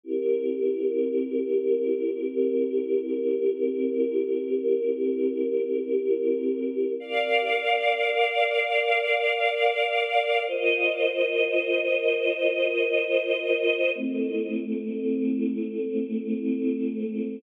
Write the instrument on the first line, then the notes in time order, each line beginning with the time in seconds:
choir aahs
0.03 C4 E4 G4 A#4
7.00 A#4 D5 F5
10.47 F4 A#4 C5 D#5
13.94 A3 C4 E4